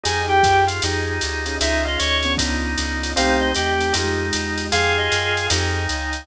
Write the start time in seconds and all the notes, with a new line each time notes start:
0.03 F2 D#4 F4 G4 G#4 G#5, ride
0.28 G4 G5
0.43 F#2, kick, hi-hat pedal, ride
0.67 F4, ride
0.82 F2 D#4 F4 G4 G#4, ride
1.21 D2, hi-hat pedal, ride
1.46 C#4 D#4 F4 G#4, ride
1.61 C#2 C#4 D#4 F4 G#4 E5, ride
1.84 F4 D#5
1.99 D2 C#5, hi-hat pedal, ride
2.23 B3 C#4 D4 F4, ride
2.37 C#2 B3 C#4 D4 D#4 F4, kick, ride
2.78 C#2, hi-hat pedal, ride
3.03 B3 C#4 D4 F4, ride
3.16 C2 A3 C4 D#4 G4 F5, ride
3.40 D#5
3.55 E2 G4, hi-hat pedal, ride
3.78 A3 C4 D#4 G4, ride
3.93 F2 G#3 D#4 F4 G4, ride
4.33 E2, hi-hat pedal, ride
4.58 ride
4.72 F2 D#4 F4 G4 G#4 D#5 F5 G5 G#5, ride
4.97 D#5
5.12 F#2, hi-hat pedal, ride
5.37 ride
5.50 F2 D#4 F4 G4 G#4 D#5 F5 G5 G#5, ride
5.89 C#2, hi-hat pedal, ride
6.13 ride